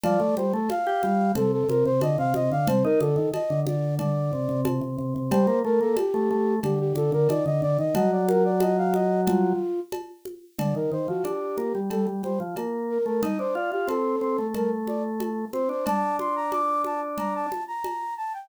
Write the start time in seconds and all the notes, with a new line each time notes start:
0.04 F3 D5, cowbell, low conga
0.20 A3
0.37 G3 C5, high conga
0.53 A3 A4
0.69 F5, cowbell, high conga
0.87 G4
1.03 G3, high conga
1.35 C3 A4, cowbell, low conga
1.52 A4
1.69 C3 A#4, high conga
1.85 C3 C5
2.01 D3 D#5, cowbell, high conga
2.18 C3 F5
2.34 C3 D#5, high conga
2.51 D3 F5
2.67 C3 C5, cowbell, low conga
2.84 D#4 A#4
3.01 D3 A4, high conga
3.16 D#3
3.34 D#5, cowbell, high conga
3.50 D3
3.66 D3 D5, high conga
3.99 D3 D5, cowbell, low conga
4.33 C3
4.49 C3
4.65 C3, cowbell, high conga
4.81 C3
4.98 C3
5.16 C3
5.31 G3 C5, cowbell, low conga
5.47 A#3
5.64 A3 A#4
5.81 A#3 A4
5.97 G4, cowbell, high conga
6.14 A3
6.31 A3
6.63 D3 G4, cowbell, low conga
6.80 G4
6.95 D3 A4, high conga
7.12 D3 A#4
7.29 D#3 D5, cowbell, high conga
7.46 D3 D#5
7.62 D3 D5
7.79 D#3 D#5
7.95 F#3 D#5, cowbell, low conga
8.12 D5
8.28 A#4, high conga
8.45 D5
8.60 D#5, cowbell, high conga
8.77 F5
8.94 D#5, high conga
9.27 F4, cowbell, low conga
9.92 cowbell, high conga
10.25 high conga
10.59 D3 D5, cowbell, low conga
10.75 D#3 A#4
10.92 D#3 C5
11.08 F3 F#4
11.24 D4 G4, cowbell, high conga
11.57 A#3, high conga
11.75 G3
11.90 G3 A4, cowbell, low conga
12.07 G3
12.23 G3 C5, high conga
12.40 F3
12.56 A#3, cowbell, high conga
12.90 A#4
13.06 A3 A#4
13.23 D#4 D#5, cowbell, low conga
13.39 D4 C5
13.55 F4 D5
13.72 F4 G4
13.88 C4 A4, cowbell, high conga
14.21 C4
14.38 A3
14.54 A3 A#4, cowbell, low conga
14.87 D5, high conga
15.20 cowbell, high conga
15.53 C4 C5, high conga
15.69 D4 C5
15.86 D4 A5, cowbell, low conga
16.19 C6, high conga
16.36 A#5
16.52 D6, cowbell, high conga
16.84 A5, high conga
17.18 A#5, cowbell, low conga
17.35 A5
17.52 high conga
17.68 A#5
17.84 cowbell, high conga
18.17 A5
18.34 G5